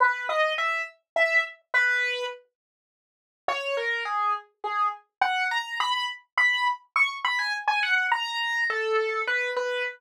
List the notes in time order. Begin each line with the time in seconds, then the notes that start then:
0.00 B4
0.29 D#5
0.58 E5
1.16 E5
1.74 B4
3.48 C#5
3.77 A#4
4.05 G#4
4.64 G#4
5.21 F#5
5.51 A#5
5.80 B5
6.38 B5
6.96 C#6
7.25 B5
7.39 G#5
7.68 G#5
7.83 F#5
8.12 A#5
8.70 A4
9.27 B4
9.57 B4